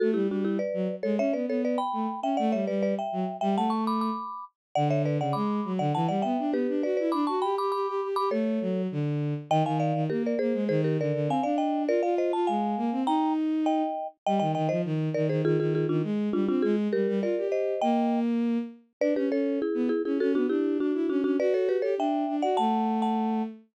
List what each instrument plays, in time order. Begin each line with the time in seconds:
0.00 violin A3, marimba F#4 A4
0.14 violin G3, marimba E4 G4
0.29 violin G3, marimba D4 F#4
0.45 marimba E4 G4
0.59 marimba B4 D5
0.74 violin F#3
1.03 violin G#3, marimba A4 C#5
1.18 violin C#4, marimba C#5 E5
1.33 violin B3, marimba B4 D5
1.48 violin B3, marimba A4 C#5
1.65 marimba B4 D5
1.78 marimba G5 B5
1.93 violin A3
2.22 violin C#4, marimba E5 G5
2.37 violin A3, marimba D5 F#5
2.52 violin G3, marimba C#5 E5
2.67 violin G3, marimba B4 D5
2.83 marimba B4 D5
2.99 marimba E5 G5
3.12 violin F#3
3.41 violin G3, marimba E5 G5
3.56 violin A3, marimba F#5 A5
3.70 marimba A5 C#6
3.87 marimba B5 D6
4.01 marimba B5 D6
4.75 violin D3, marimba D5 F#5
4.90 marimba C#5 E5
5.06 marimba B4 D5
5.19 violin C#3, marimba D5 F#5
5.33 violin G#3, marimba B5 D6
5.65 violin F#3
5.79 violin D3, marimba D5 F#5
5.95 violin E3, marimba F#5 A5
6.08 violin G3, marimba D5 F#5
6.22 violin B3, marimba E5 G5
6.39 violin D4
6.53 violin B3, marimba G4 B4
6.68 violin D4
6.83 violin F#4, marimba B4 D5
6.97 violin E4, marimba B4 D5
7.12 violin D4, marimba B5 D6
7.27 violin F#4, marimba A5 C#6
7.42 violin G4, marimba G5 B5
7.58 violin G4, marimba B5 D6
7.72 violin G4, marimba B5 D6
7.88 violin G4
8.02 violin G4
8.16 violin G4, marimba B5 D6
8.31 violin A3, marimba A4 C#5
8.61 violin F#3
8.92 violin D3
9.50 violin D#3, marimba D#5 G5
9.65 violin D#3, marimba F5 G#5
9.80 marimba D5 F5
9.94 violin D#3
10.10 violin A#3, marimba G4 A#4
10.26 marimba A#4 D5
10.39 violin A#3, marimba G#4 C5
10.54 violin G#3
10.69 violin D#3, marimba G#4 C5
10.84 marimba G4 A#4
10.99 violin D3, marimba A#4 D5
11.14 violin D3
11.28 violin C4, marimba F5 G#5
11.43 violin D4, marimba D5 F5
11.58 marimba D#5 G5
11.88 violin F4, marimba A#4 D5
12.03 violin F4, marimba D5 F5
12.18 marimba C5 D#5
12.33 violin F4, marimba A5
12.47 violin G#3, marimba F5 G#5
12.77 violin A#3
12.92 violin C4
13.06 violin D#4, marimba G5 A#5
13.66 marimba D#5 G5
14.26 violin G3, marimba D#5 G5
14.40 violin D#3, marimba D#5 G5
14.55 violin D#3, marimba D#5 G5
14.69 violin F3, marimba C5 D#5
14.85 violin D#3
15.14 violin D#3, marimba A#4 D5
15.29 violin D#3, marimba G#4 C5
15.45 violin D#3, marimba F4 G#4
15.59 violin D#3, marimba F4 G#4
15.75 marimba F4 G#4
15.89 violin D#3, marimba D4 F4
16.03 violin G#3
16.33 violin G3, marimba D4 F4
16.48 violin C4, marimba D4 F4
16.62 violin G#3, marimba F4 G#4
16.93 violin G3, marimba G4 A#4
17.08 violin G3
17.22 violin F4, marimba A#4 D5
17.37 violin G4
17.52 marimba C5 D#5
17.81 violin A#3, marimba D#5 G5
19.01 violin D4, marimba B4 D5
19.16 violin C#4, marimba G4 B4
19.31 violin C#4, marimba A4 C#5
19.62 marimba E4 G#4
19.74 violin B3
19.89 marimba E4 G#4
20.05 violin C#4, marimba E4 G#4
20.20 violin C#4, marimba F#4 A4
20.35 violin B3, marimba D4 F#4
20.49 violin D4, marimba E4 G4
20.80 violin D4, marimba D4 F#4
20.94 violin E4
21.09 violin C#4, marimba D4 F#4
21.24 violin C#4, marimba D4 F#4
21.39 violin F#4, marimba B4 D5
21.54 marimba A4 C#5
21.69 marimba G4 B4
21.82 violin G4, marimba A4 C#5
21.98 violin D4, marimba E5 G5
22.28 violin D4
22.42 violin F#4, marimba D5 F#5
22.57 violin A3, marimba F#5 A5
23.02 marimba F#5 A5